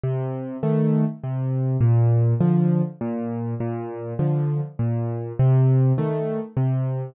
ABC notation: X:1
M:3/4
L:1/8
Q:1/4=101
K:Bb
V:1 name="Acoustic Grand Piano"
C,2 [E,A,]2 C,2 | B,,2 [D,F,]2 B,,2 | B,,2 [D,F,]2 B,,2 | C,2 [E,A,]2 C,2 |]